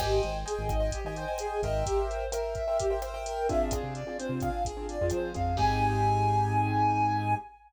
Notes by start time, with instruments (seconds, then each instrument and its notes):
0.00 synth bass 1 G#1, flute G4, acoustic grand piano C5 D#5 G5 G#5, kick, cross-stick, crash
0.23 synth bass 1 G#1, flute C5, closed hi-hat
0.46 flute G#4, acoustic grand piano C5 D#5 G5 G#5, closed hi-hat
0.59 synth bass 1 G#1
0.69 synth bass 1 G#1, flute D#5, kick, cross-stick, closed hi-hat
0.80 acoustic grand piano C5 D#5 G5 G#5
0.91 flute G4, kick, closed hi-hat
1.04 synth bass 1 G#1, acoustic grand piano C5 D#5 G5 G#5
1.16 flute C5, acoustic grand piano C5 D#5 G5 G#5, closed hi-hat
1.28 acoustic grand piano C5 D#5 G5 G#5
1.38 flute G#4, cross-stick, closed hi-hat
1.63 synth bass 1 G#1, acoustic grand piano A#4 C5 E5 G5, flute D#5, kick, closed hi-hat
1.86 flute G4, kick, closed hi-hat
2.09 flute C5, closed hi-hat
2.32 acoustic grand piano A#4 C5 E5 G5, flute A#4, cross-stick, closed hi-hat
2.55 flute E5, kick, closed hi-hat
2.68 acoustic grand piano A#4 C5 E5 G5
2.79 flute G4, kick, closed hi-hat
2.90 acoustic grand piano A#4 C5 E5 G5
3.02 acoustic grand piano A#4 C5 E5 G5, flute C5, cross-stick, closed hi-hat
3.14 acoustic grand piano A#4 C5 E5 G5
3.26 flute A#4, closed hi-hat
3.49 acoustic grand piano C4 D4 F4 G#4, flute E5, kick, closed hi-hat
3.71 synth bass 1 F2, flute G#4, kick, cross-stick, closed hi-hat
3.83 synth bass 1 C3
3.95 flute D5, closed hi-hat
4.07 acoustic grand piano C4 D4 F4 G#4
4.19 acoustic grand piano C4 D4 F4 G#4, flute C5, closed hi-hat
4.29 synth bass 1 C3
4.40 acoustic grand piano C4 D4 F4 G#4, flute F5, kick, cross-stick, closed hi-hat
4.65 flute G#4, kick, closed hi-hat
4.77 acoustic grand piano C4 D4 F4 G#4
4.88 flute D5, closed hi-hat
5.01 synth bass 1 F2, acoustic grand piano C4 D4 F4 G#4
5.10 synth bass 1 F3, flute C5, cross-stick, closed hi-hat
5.34 synth bass 1 F2, acoustic grand piano C4 D4 F4 G#4, flute F5, kick, closed hi-hat
5.57 synth bass 1 G#2, acoustic grand piano C4 D#4 G4 G#4, flute G#5, kick, crash